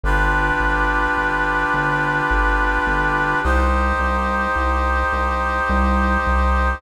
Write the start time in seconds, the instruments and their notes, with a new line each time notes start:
0.04 synth bass 1 G1, brass section D4 F4 G4 B4
0.60 synth bass 1 G1
1.17 synth bass 1 G1
1.74 synth bass 1 G1
2.31 synth bass 1 G1
2.87 synth bass 1 G1
3.43 synth bass 1 C2, brass section D#4 G4 C5
4.00 synth bass 1 C2
4.56 synth bass 1 C2
5.13 synth bass 1 C2
5.70 synth bass 1 C2
6.27 synth bass 1 C2